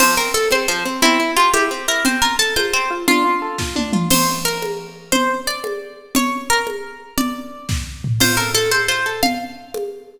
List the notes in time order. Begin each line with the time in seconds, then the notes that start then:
0.00 F3 C5, crash, low conga
0.17 C4 A#4
0.34 A4
0.51 C4 C5, high conga
0.68 F3 C5
0.85 C4
1.02 C4 E4, low conga
1.20 E4
1.37 F4 G4
1.54 E4 G4, high conga
1.71 C4
1.88 E4 A#4
2.05 C4 C5, low conga
2.22 F4 A#4
2.39 A4
2.56 F4 C5, high conga
2.73 C4 C5
2.91 F4
3.08 D4 F4, low conga
3.25 F4
3.42 A4
3.58 F4, kick, snare
3.76 D4, high tom
3.93 F4, mid tom
4.10 C5, crash, low conga
4.45 A#4
4.62 high conga
5.12 C5, low conga
5.47 D5
5.64 high conga
6.15 C#5, low conga
6.50 A#4
6.67 high conga
7.18 D5, low conga
7.69 kick, snare
8.04 floor tom
8.20 F4 C5, crash, low conga
8.37 A4 A#4
8.54 A4 C5
8.71 A4 C5, high conga
8.88 F4 C5
9.06 A4
9.23 F5, low conga
9.74 high conga